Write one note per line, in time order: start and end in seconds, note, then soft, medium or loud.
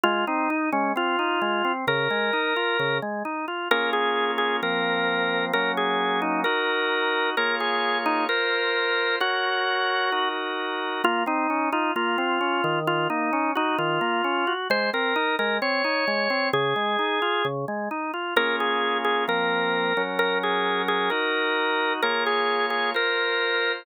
0.04 0.25 G#3 medium
0.04 0.25 F4 loud
0.27 0.48 C4 medium
0.27 0.69 D#4 medium
0.50 0.71 D#4 medium
0.72 0.93 G#3 medium
0.72 0.92 C#4 medium
0.96 1.16 C4 medium
0.96 1.72 F4 medium
1.19 1.40 D#4 medium
1.42 1.62 G#3 medium
1.65 1.85 C4 medium
1.87 2.08 C#3 medium
1.87 2.98 A#4 loud
2.10 2.31 G#3 medium
2.33 2.54 D#4 medium
2.56 2.77 F4 medium
2.79 3.00 C#3 medium
3.02 3.23 G#3 medium
3.25 3.46 D#4 medium
3.48 3.68 F4 medium
3.71 4.61 A#3 medium
3.71 4.61 C#4 medium
3.71 4.61 F4 medium
3.71 4.61 G#4 medium
3.71 3.90 A#4 loud
3.93 4.31 G#4 loud
4.38 4.57 G#4 loud
4.62 5.52 F3 medium
4.62 5.52 A#3 medium
4.62 5.52 C4 medium
4.62 5.45 A#4 loud
5.53 6.44 F#3 medium
5.53 6.44 A#3 medium
5.53 6.44 C#4 medium
5.53 5.72 A#4 loud
5.77 6.20 G#4 loud
6.22 6.41 D#4 loud
6.44 7.35 D#4 medium
6.44 7.35 F#4 medium
6.44 7.30 A#4 loud
7.37 8.27 A#3 medium
7.37 8.27 F4 medium
7.37 8.27 G#4 medium
7.37 7.56 A#4 loud
7.37 8.27 C#5 medium
7.60 7.98 G#4 loud
8.06 8.25 D#4 loud
8.29 9.19 F4 medium
8.29 9.16 A#4 loud
8.29 9.19 A#4 medium
8.29 9.19 C5 medium
9.20 10.29 F#4 loud
9.20 10.10 A#4 medium
9.20 10.10 C#5 medium
10.12 11.02 D#4 medium
10.12 11.02 F#4 medium
10.12 11.02 A#4 medium
11.04 11.24 A#3 loud
11.04 11.23 F4 loud
11.26 11.47 C4 medium
11.26 11.69 D#4 loud
11.50 11.71 C#4 medium
11.72 11.92 D#4 loud
11.72 11.93 F4 medium
11.96 12.16 A#3 medium
11.96 12.79 F4 loud
12.18 12.39 C4 medium
12.41 12.61 C#4 medium
12.64 13.08 D#3 loud
12.87 13.08 F4 loud
13.10 13.31 A#3 medium
13.10 13.51 D#4 loud
13.33 13.53 C#4 medium
13.55 13.77 D#4 loud
13.55 13.76 F#4 medium
13.78 13.99 D#3 medium
13.78 14.53 F4 loud
14.01 14.22 A#3 medium
14.24 14.45 C#4 medium
14.47 14.68 F#4 medium
14.70 14.90 G#3 medium
14.70 14.90 C5 loud
14.93 15.14 C4 medium
14.93 15.35 A#4 loud
15.16 15.36 D#4 medium
15.39 15.59 G#3 medium
15.39 15.57 A#4 loud
15.62 15.82 C4 medium
15.62 16.49 C#5 loud
15.84 16.05 D#4 medium
16.08 16.28 G#3 medium
16.30 16.51 C4 medium
16.53 16.74 C#3 loud
16.53 17.46 G#4 loud
16.76 16.97 G#3 medium
16.99 17.19 D#4 medium
17.22 17.43 F4 medium
17.45 17.65 C#3 medium
17.68 17.89 G#3 medium
17.91 18.11 D#4 medium
18.14 18.34 F4 medium
18.36 19.26 A#3 medium
18.36 19.26 C#4 medium
18.36 19.26 F4 medium
18.36 19.26 G#4 medium
18.36 18.56 A#4 loud
18.60 18.98 G#4 loud
19.05 19.24 G#4 loud
19.28 19.93 F3 medium
19.28 19.93 A#3 medium
19.28 19.93 C4 medium
19.28 20.02 A#4 loud
19.97 21.10 F#3 medium
19.97 21.10 C#4 medium
19.97 21.10 A#4 medium
20.19 20.38 A#4 loud
20.43 20.82 G#4 loud
20.88 21.10 G#4 loud
21.10 22.01 D#4 medium
21.10 22.01 F#4 medium
21.10 21.93 A#4 loud
22.02 22.93 A#3 medium
22.02 22.93 F4 medium
22.02 22.93 G#4 medium
22.02 22.24 A#4 loud
22.02 22.93 C#5 medium
22.26 22.66 G#4 loud
22.70 22.90 G#4 loud
22.94 23.84 F4 medium
22.94 23.84 A#4 medium
22.94 23.72 A#4 loud
22.94 23.84 C5 medium